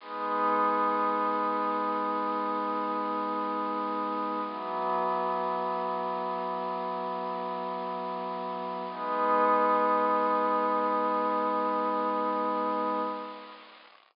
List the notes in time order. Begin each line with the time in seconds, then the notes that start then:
0.00 G#3 B3 D#4
4.44 E3 F#3 B3
8.89 G#3 B3 D#4